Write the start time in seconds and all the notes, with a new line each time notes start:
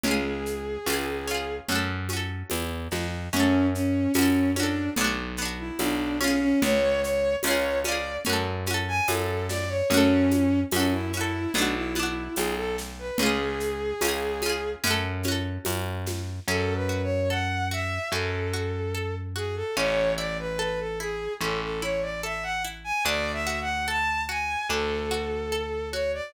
0.03 C#2 C#4 G#4, low conga, shaker
0.08 F4 G#4
0.46 shaker
0.86 C#2 C#4 F4, tambourine, high conga, shaker
0.93 G#4
1.27 C#4 F4, shaker
1.34 G#4
1.68 F#2 C#4 F#4, low conga, shaker
1.76 A4
2.09 C#4, high conga, shaker
2.13 F#4 A4
2.50 E2, tambourine, high conga, shaker
2.91 F2, snare, high conga, shaker
3.33 F#2 C#4 F#4, low conga, shaker
3.40 A4
3.73 C#4, shaker
4.14 F#2 C#4, tambourine, high conga, shaker
4.18 F#4 A4
4.55 C#4 D4, high conga, shaker
4.60 F#4 A4
4.96 B1 B3, low conga, shaker
5.01 D4 F#4
5.37 B3, shaker
5.42 D4 F#4
5.58 E4
5.79 B1 D4, tambourine, high conga, shaker
6.20 C#4 F4, snare, high conga, shaker
6.28 G#4
6.40 C#4
6.62 C#2 C#5, low conga, shaker
7.01 C#5, shaker
7.43 C#2 C#4 C#5, tambourine, high conga, shaker
7.47 F4 G#4
7.84 C#4 D5, high conga, shaker
7.88 F4 G#4
8.24 F#2 C#4, low conga, shaker
8.29 F#4 A4
8.66 C#4, high conga, shaker
8.71 F#4 A4
8.88 G#5
9.08 F#2 A4, tambourine, high conga, shaker
9.49 D5, snare, high conga, shaker
9.69 C#5
9.90 F#2 C#4 F#4, low conga, shaker
9.97 A4
10.31 high conga, shaker
10.71 F#2 C#4, tambourine, high conga, shaker
10.76 F#4 A4
10.92 E4
11.13 C#4 E4, shaker
11.17 F#4 A4
11.54 B1 B3 D4, low conga, shaker
11.58 D4 F#4
11.75 E4
11.95 B3 E4, high conga, shaker
11.99 D4 F#4
12.36 B1 G#4, tambourine, high conga, shaker
12.57 A4
12.78 snare, shaker
12.99 B4
13.18 C#2 C#4 G#4, low conga, shaker
13.23 F4 G#4
13.60 shaker
14.01 C#2 C#4 F4, tambourine, high conga, shaker
14.08 G#4
14.42 C#4, high conga, shaker
14.46 F4 G#4
14.84 F#2 C#4 F#4, low conga, shaker
14.91 A4
15.23 C#4, high conga, shaker
15.28 F#4 A4
15.65 F#2, tambourine, high conga, shaker
16.06 snare, high conga, shaker
16.47 F#2 C#4 A4
16.75 B4
16.89 F#4
17.03 C#5
17.30 A4 F#5
17.71 F#4 E5
18.11 F#2 C#4 A4
18.53 F#4
18.95 A4
19.36 F#4 G#4
19.56 A4
19.77 A1 C#4 C#5
20.18 E4 D5
20.39 B4
20.59 A4 B4
20.79 A4
21.00 E4 G#4
21.41 A1 C#4 A4
21.63 A4
21.82 E4 C#5
22.02 D5
22.23 A4 E5
22.43 F#5
22.64 E4
22.84 G#5
23.05 D2 D4 D5
23.33 E5
23.47 F#4
23.61 F#5
23.88 A4 A5
24.29 F#4 G#5
24.69 D2 D4 A4
25.11 F#4
25.52 A4
25.92 F#4 C#5
26.14 D5